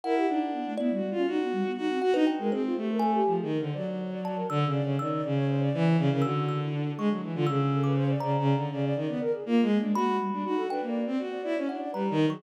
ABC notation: X:1
M:5/8
L:1/16
Q:1/4=121
K:none
V:1 name="Violin"
E2 D4 (3E2 ^F2 =F2 | ^F4 F2 F ^D z ^G, | C2 A,4 (3F,2 ^D,2 =D,2 | ^F,6 (3D,2 ^C,2 C,2 |
^D,2 ^C,4 E,2 C, C, | D,6 ^G, ^F, E, D, | ^C,6 (3C,2 C,2 D,2 | ^C,2 ^D, B, z2 (3^A,2 ^G,2 =D2 |
^F2 z D F2 D ^A,2 C | ^F2 E ^C D2 (3G,2 ^D,2 ^F,2 |]
V:2 name="Kalimba"
^f6 d4 | z6 ^f B g2 | c4 ^g3 z3 | z4 a2 e'2 z2 |
e'2 z8 | e'2 e' z3 ^c'2 z2 | e'3 d' z2 ^a4 | z10 |
b6 g z3 | z4 ^f2 ^a2 z ^c' |]
V:3 name="Flute"
^A G ^D z B, =A, B, G, G, ^C | ^D B, G, B, D C ^F =D2 ^A | ^G F =G ^A =A G2 ^G ^A c | d d ^c d d ^A d d d c |
d d d ^c =c d2 ^c d ^A | ^F3 E D5 =F | ^G z A B c d d d d d | d d d d ^A ^G F2 ^A, ^G, |
^A, ^G, =G, G, ^D =A (3B2 =d2 d2 | z d d ^c d d B z2 ^G |]